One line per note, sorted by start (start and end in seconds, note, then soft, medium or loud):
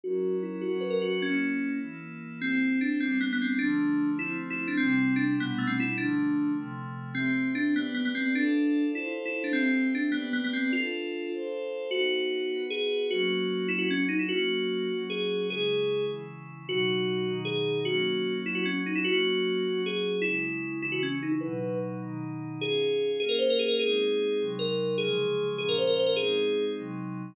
0.04 0.62 F#3 medium
0.04 0.62 C#4 loud
0.04 0.62 E4 loud
0.04 0.36 F#4 loud
0.04 0.62 A#4 medium
0.43 0.61 E4 medium
0.61 1.22 F#3 medium
0.61 1.22 C#4 loud
0.61 0.79 F#4 medium
0.61 1.22 F#4 loud
0.61 1.22 A#4 medium
0.81 0.90 B4 medium
0.90 1.00 A#4 medium
1.02 1.20 F#4 medium
1.22 1.81 A#3 medium
1.22 1.72 C#4 medium
1.22 1.82 C#4 loud
1.22 1.81 E4 medium
1.81 2.40 E3 medium
1.81 2.40 A#3 medium
1.81 2.40 E4 loud
2.41 3.00 C4 loud
2.41 2.80 C4 medium
2.41 3.00 E4 medium
2.41 3.00 G4 medium
2.81 2.98 D4 medium
3.00 3.59 G3 medium
3.00 3.59 B3 medium
3.00 3.19 C4 medium
3.00 3.59 D4 medium
3.21 3.30 B3 medium
3.33 3.42 B3 medium
3.42 3.60 C4 medium
3.59 4.19 D3 loud
3.59 4.18 F3 loud
3.59 4.18 A3 loud
3.59 4.10 D4 medium
4.19 4.78 F3 loud
4.19 4.78 A3 medium
4.19 4.78 C4 loud
4.19 4.28 E4 medium
4.50 4.60 E4 medium
4.68 4.77 D4 medium
4.77 5.38 C3 loud
4.77 5.38 G3 loud
4.77 5.14 C4 loud
4.77 5.38 E4 loud
5.16 5.34 D4 medium
5.38 5.97 B2 loud
5.38 5.97 G3 medium
5.38 5.59 B3 medium
5.38 5.97 D4 medium
5.58 5.68 A3 medium
5.67 5.77 C4 medium
5.80 5.97 E4 medium
5.98 6.57 D3 loud
5.98 6.57 F3 medium
5.98 6.57 A3 loud
5.98 6.51 D4 medium
6.57 7.16 C3 loud
6.57 7.16 F3 loud
6.57 7.16 A3 loud
7.15 7.48 C4 medium
7.15 7.75 C4 medium
7.15 7.75 G4 medium
7.15 7.75 E5 loud
7.55 7.74 D4 medium
7.76 7.93 B3 medium
7.76 8.35 G4 medium
7.76 8.35 B4 medium
7.76 8.35 D5 medium
7.94 8.04 B3 medium
8.05 8.15 B3 medium
8.15 8.34 C4 medium
8.35 8.84 D4 medium
8.35 8.94 F4 medium
8.35 8.94 A4 loud
8.35 8.94 D5 medium
8.94 9.04 E4 medium
8.94 9.53 F4 loud
8.94 9.53 A4 loud
8.94 9.53 C5 medium
9.25 9.35 E4 medium
9.44 9.53 D4 medium
9.53 9.87 C4 medium
9.53 10.13 C4 loud
9.53 10.13 G4 loud
9.53 10.13 E5 medium
9.95 10.11 D4 medium
10.12 10.29 B3 medium
10.12 10.72 G4 loud
10.12 10.72 B4 loud
10.12 10.72 D5 medium
10.33 10.42 B3 medium
10.44 10.54 B3 medium
10.53 10.72 C4 medium
10.73 11.32 D4 medium
10.73 11.28 F4 loud
10.73 11.32 F4 medium
10.73 11.32 A4 medium
11.32 11.91 F4 loud
11.32 11.91 A4 loud
11.32 11.91 C5 loud
11.91 12.50 B3 medium
11.91 12.51 D#4 medium
11.91 12.63 F#4 medium
11.91 12.50 F#4 medium
12.51 13.09 B3 medium
12.51 13.09 F#4 medium
12.51 13.09 B4 loud
12.70 13.07 G#4 medium
13.10 13.69 F#3 loud
13.10 13.69 A#3 medium
13.10 13.69 C#4 medium
13.10 13.69 F#4 medium
13.68 14.29 F#3 medium
13.68 14.29 C#4 medium
13.68 13.78 E4 medium
13.68 14.29 F#4 medium
13.78 13.88 F#4 medium
13.91 14.00 C#4 medium
14.09 14.18 D#4 medium
14.19 14.28 E4 medium
14.29 14.88 F#3 medium
14.29 14.88 A#3 loud
14.29 14.88 C#4 medium
14.29 14.97 F#4 medium
14.89 15.48 F#3 medium
14.89 15.48 C#4 medium
14.89 15.48 F#4 medium
15.10 15.47 G#4 medium
15.48 16.07 C#3 medium
15.48 16.07 G#3 medium
15.48 16.07 E4 medium
15.48 16.05 G#4 medium
16.08 16.66 C#3 medium
16.08 16.66 E3 medium
16.08 16.66 E4 medium
16.67 17.26 B2 medium
16.67 17.26 F#3 loud
16.67 17.26 D#4 medium
16.67 17.34 F#4 medium
17.26 17.85 B2 medium
17.26 17.85 D#3 medium
17.26 17.85 D#4 loud
17.45 17.79 G#4 medium
17.85 18.45 F#3 medium
17.85 18.45 A#3 medium
17.85 18.45 C#4 medium
17.85 18.34 F#4 medium
18.45 19.04 F#3 medium
18.45 19.04 C#4 medium
18.45 18.55 E4 medium
18.45 19.04 F#4 medium
18.55 18.64 F#4 medium
18.65 18.75 C#4 medium
18.86 18.96 D#4 medium
18.95 19.05 E4 medium
19.04 19.64 F#3 medium
19.04 19.64 A#3 medium
19.04 19.64 C#4 medium
19.04 19.81 F#4 loud
19.64 20.23 F#3 medium
19.64 20.23 C#4 medium
19.64 20.23 F#4 medium
19.86 20.23 G#4 medium
20.22 20.82 C#3 medium
20.22 20.82 G#3 medium
20.22 20.71 E4 loud
20.22 20.82 E4 medium
20.82 21.42 C#3 medium
20.82 21.42 E3 medium
20.82 20.92 E4 medium
20.82 21.42 E4 loud
20.92 21.01 F#4 medium
21.03 21.12 C#4 medium
21.23 21.32 D#4 medium
21.32 21.41 E4 medium
21.41 22.01 B2 loud
21.41 22.01 F#3 medium
21.41 22.01 D#4 medium
21.41 21.75 B4 medium
22.02 22.61 B2 medium
22.02 22.61 D#3 medium
22.02 22.61 D#4 loud
22.61 23.20 C#4 medium
22.61 23.20 F4 medium
22.61 23.11 G#4 medium
22.61 23.20 G#4 medium
23.20 23.79 A#3 medium
23.20 23.79 C#4 medium
23.20 23.79 F4 medium
23.20 23.29 G#4 medium
23.29 23.38 A#4 medium
23.39 23.48 C5 medium
23.50 23.60 A#4 medium
23.59 23.69 G#4 medium
23.68 23.78 A#4 medium
23.79 24.38 G#3 medium
23.79 24.38 C4 medium
23.79 24.38 D#4 medium
23.79 24.44 G#4 loud
24.39 24.98 C3 medium
24.39 24.98 F#3 medium
24.39 24.98 D#4 medium
24.59 24.96 A#4 medium
24.98 25.58 C#3 medium
24.98 25.58 F3 loud
24.98 25.58 G#3 medium
24.98 25.48 G#4 medium
25.58 26.17 A#2 medium
25.58 26.17 F3 medium
25.58 26.17 C#4 medium
25.58 25.68 G#4 medium
25.69 25.78 A#4 medium
25.78 25.88 C5 medium
25.87 25.97 A#4 medium
25.96 26.06 C5 medium
26.06 26.16 A#4 medium
26.16 26.76 G#3 medium
26.16 26.76 C4 medium
26.16 26.76 D#4 medium
26.16 26.65 G#4 loud
26.77 27.35 C3 medium
26.77 27.35 F#3 medium
26.77 27.35 D#4 medium